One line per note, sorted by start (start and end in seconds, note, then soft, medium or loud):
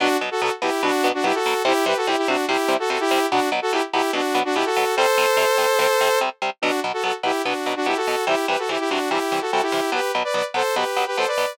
0.00 0.08 B2 medium
0.00 0.08 F#3 medium
0.00 0.08 B3 medium
0.00 0.17 D4 loud
0.00 0.17 F#4 loud
0.21 0.29 B2 medium
0.21 0.29 F#3 medium
0.21 0.29 B3 medium
0.31 0.41 F#4 medium
0.31 0.41 A4 loud
0.41 0.50 B2 medium
0.41 0.50 F#3 medium
0.41 0.50 B3 medium
0.41 0.51 F#4 medium
0.41 0.51 A4 loud
0.62 0.70 B2 medium
0.62 0.70 F#3 medium
0.62 0.70 B3 medium
0.62 0.82 E4 medium
0.62 0.82 G4 loud
0.83 0.91 B2 medium
0.83 0.91 F#3 medium
0.83 0.91 B3 medium
0.83 1.08 D4 loud
0.83 1.08 F#4 loud
1.04 1.12 B2 medium
1.04 1.12 F#3 medium
1.04 1.12 B3 medium
1.14 1.24 D4 medium
1.14 1.24 F#4 loud
1.24 1.32 B2 medium
1.24 1.32 F#3 medium
1.24 1.32 B3 medium
1.24 1.34 E4 loud
1.24 1.34 G4 loud
1.34 1.62 F#4 medium
1.34 1.62 A4 loud
1.46 1.54 B2 medium
1.46 1.54 F#3 medium
1.46 1.54 B3 medium
1.65 1.73 C3 medium
1.65 1.73 G3 medium
1.65 1.73 C4 medium
1.65 1.85 E4 loud
1.65 1.85 G4 loud
1.86 1.94 C3 medium
1.86 1.94 G3 medium
1.86 1.94 C4 medium
1.86 1.96 G4 medium
1.86 1.96 B4 loud
1.97 2.07 F#4 medium
1.97 2.07 A4 loud
2.07 2.16 C3 medium
2.07 2.16 G3 medium
2.07 2.16 C4 medium
2.07 2.17 E4 medium
2.07 2.17 G4 loud
2.18 2.27 E4 medium
2.18 2.27 G4 loud
2.28 2.36 C3 medium
2.28 2.36 G3 medium
2.28 2.36 C4 medium
2.28 2.45 D4 medium
2.28 2.45 F#4 loud
2.48 2.57 C3 medium
2.48 2.57 G3 medium
2.48 2.57 C4 medium
2.48 2.74 E4 medium
2.48 2.74 G4 loud
2.68 2.77 C3 medium
2.68 2.77 G3 medium
2.68 2.77 C4 medium
2.79 2.89 F#4 medium
2.79 2.89 A4 loud
2.90 2.98 C3 medium
2.90 2.98 G3 medium
2.90 2.98 C4 medium
2.90 3.00 F#4 medium
2.90 3.00 A4 medium
3.00 3.26 E4 loud
3.00 3.26 G4 loud
3.11 3.19 C3 medium
3.11 3.19 G3 medium
3.11 3.19 C4 medium
3.31 3.40 B2 medium
3.31 3.40 F#3 medium
3.31 3.40 B3 medium
3.31 3.49 D4 medium
3.31 3.49 F#4 loud
3.52 3.60 B2 medium
3.52 3.60 F#3 medium
3.52 3.60 B3 medium
3.62 3.72 F#4 loud
3.62 3.72 A4 loud
3.72 3.81 B2 medium
3.72 3.81 F#3 medium
3.72 3.81 B3 medium
3.72 3.82 E4 loud
3.72 3.82 G4 loud
3.93 4.02 B2 medium
3.93 4.02 F#3 medium
3.93 4.02 B3 medium
3.93 4.11 E4 medium
3.93 4.11 G4 loud
4.13 4.21 B2 medium
4.13 4.21 F#3 medium
4.13 4.21 B3 medium
4.13 4.39 D4 medium
4.13 4.39 F#4 loud
4.34 4.43 B2 medium
4.34 4.43 F#3 medium
4.34 4.43 B3 medium
4.45 4.55 D4 loud
4.45 4.55 F#4 loud
4.55 4.64 B2 medium
4.55 4.64 F#3 medium
4.55 4.64 B3 medium
4.55 4.65 E4 loud
4.55 4.65 G4 loud
4.65 4.95 F#4 medium
4.65 4.95 A4 loud
4.76 4.85 B2 medium
4.76 4.85 F#3 medium
4.76 4.85 B3 medium
4.96 5.06 C3 medium
4.96 5.06 G3 medium
4.96 5.06 C4 medium
4.96 6.19 A4 loud
4.96 6.19 C5 loud
5.17 5.26 C3 medium
5.17 5.26 G3 medium
5.17 5.26 C4 medium
5.37 5.45 C3 medium
5.37 5.45 G3 medium
5.37 5.45 C4 medium
5.58 5.66 C3 medium
5.58 5.66 G3 medium
5.58 5.66 C4 medium
5.79 5.87 C3 medium
5.79 5.87 G3 medium
5.79 5.87 C4 medium
6.01 6.09 C3 medium
6.01 6.09 G3 medium
6.01 6.09 C4 medium
6.21 6.29 C3 medium
6.21 6.29 G3 medium
6.21 6.29 C4 medium
6.42 6.50 C3 medium
6.42 6.50 G3 medium
6.42 6.50 C4 medium
6.62 6.71 B2 medium
6.62 6.71 F#3 medium
6.62 6.71 B3 medium
6.62 6.80 D4 medium
6.62 6.80 F#4 loud
6.84 6.92 B2 medium
6.84 6.92 F#3 medium
6.84 6.92 B3 medium
6.93 7.03 F#4 medium
6.93 7.03 A4 medium
7.03 7.12 B2 medium
7.03 7.12 F#3 medium
7.03 7.12 B3 medium
7.03 7.13 F#4 medium
7.03 7.13 A4 medium
7.23 7.32 B2 medium
7.23 7.32 F#3 medium
7.23 7.32 B3 medium
7.23 7.42 E4 medium
7.23 7.42 G4 medium
7.45 7.54 B2 medium
7.45 7.54 F#3 medium
7.45 7.54 B3 medium
7.45 7.73 D4 medium
7.45 7.73 F#4 medium
7.66 7.74 B2 medium
7.66 7.74 F#3 medium
7.66 7.74 B3 medium
7.76 7.86 D4 medium
7.76 7.86 F#4 loud
7.86 7.94 B2 medium
7.86 7.94 F#3 medium
7.86 7.94 B3 medium
7.86 7.96 E4 medium
7.86 7.96 G4 loud
7.96 8.25 F#4 medium
7.96 8.25 A4 medium
8.07 8.16 B2 medium
8.07 8.16 F#3 medium
8.07 8.16 B3 medium
8.27 8.35 C3 medium
8.27 8.35 E3 medium
8.27 8.35 G3 medium
8.27 8.46 E4 medium
8.27 8.46 G4 loud
8.48 8.56 C3 medium
8.48 8.56 E3 medium
8.48 8.56 G3 medium
8.48 8.58 G4 medium
8.48 8.58 B4 medium
8.59 8.69 F#4 medium
8.59 8.69 A4 medium
8.69 8.77 C3 medium
8.69 8.77 E3 medium
8.69 8.77 G3 medium
8.69 8.79 E4 medium
8.69 8.79 G4 medium
8.79 8.89 E4 medium
8.79 8.89 G4 loud
8.90 8.99 C3 medium
8.90 8.99 E3 medium
8.90 8.99 G3 medium
8.90 9.09 D4 medium
8.90 9.09 F#4 medium
9.10 9.19 C3 medium
9.10 9.19 E3 medium
9.10 9.19 G3 medium
9.10 9.40 E4 medium
9.10 9.40 G4 medium
9.32 9.40 C3 medium
9.32 9.40 E3 medium
9.32 9.40 G3 medium
9.41 9.51 F#4 medium
9.41 9.51 A4 medium
9.52 9.61 C3 medium
9.52 9.61 E3 medium
9.52 9.61 G3 medium
9.52 9.62 F#4 medium
9.52 9.62 A4 loud
9.62 9.90 E4 medium
9.62 9.90 G4 loud
9.72 9.80 C3 medium
9.72 9.80 E3 medium
9.72 9.80 G3 medium
9.92 10.00 B2 medium
9.92 10.00 F#3 medium
9.92 10.00 B3 medium
9.92 10.11 G4 medium
9.92 10.11 B4 medium
10.15 10.23 B2 medium
10.15 10.23 F#3 medium
10.15 10.23 B3 medium
10.24 10.34 B4 medium
10.24 10.34 D5 medium
10.34 10.42 B2 medium
10.34 10.42 F#3 medium
10.34 10.42 B3 medium
10.34 10.44 B4 medium
10.34 10.44 D5 medium
10.54 10.62 B2 medium
10.54 10.62 F#3 medium
10.54 10.62 B3 medium
10.54 10.75 A4 medium
10.54 10.75 C5 loud
10.76 10.84 B2 medium
10.76 10.84 F#3 medium
10.76 10.84 B3 medium
10.76 11.05 G4 medium
10.76 11.05 B4 medium
10.96 11.05 B2 medium
10.96 11.05 F#3 medium
10.96 11.05 B3 medium
11.07 11.16 G4 medium
11.07 11.16 B4 medium
11.17 11.26 B2 medium
11.17 11.26 F#3 medium
11.17 11.26 B3 medium
11.17 11.27 A4 medium
11.17 11.27 C5 loud
11.27 11.53 B4 medium
11.27 11.53 D5 medium
11.37 11.46 B2 medium
11.37 11.46 F#3 medium
11.37 11.46 B3 medium